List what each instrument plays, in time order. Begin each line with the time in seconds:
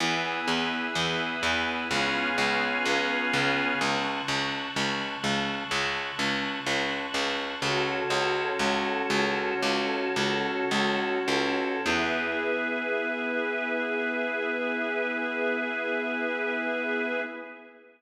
0.00 harpsichord E2, drawbar organ B3 E4 G#4, string ensemble 1 G#5 B5 E6
0.48 harpsichord E2
0.95 harpsichord E2
1.43 harpsichord E2
1.91 harpsichord C#2, drawbar organ B3 C#4 F4 G#4, string ensemble 1 G#5 B5 C#6 F6
2.38 harpsichord C#2
2.86 harpsichord C#2
3.34 harpsichord C#2
3.81 harpsichord C#2, string ensemble 1 A5 C#6 F#6
4.28 harpsichord C#2
4.76 harpsichord C#2
5.24 harpsichord C#2
5.71 harpsichord C#2
6.19 harpsichord C#2
6.66 harpsichord C#2
7.14 harpsichord C#2
7.62 harpsichord C#2, drawbar organ C#4 F#4 A4, string ensemble 1 F#4 A4 C#5
8.10 harpsichord C#2
8.59 harpsichord C#2
9.10 harpsichord C#2
9.63 harpsichord C#2
10.16 harpsichord C#2
10.71 harpsichord C#2
11.28 harpsichord C#2
11.86 harpsichord E2, drawbar organ B3 E4 G#4, string ensemble 1 G#4 B4 E5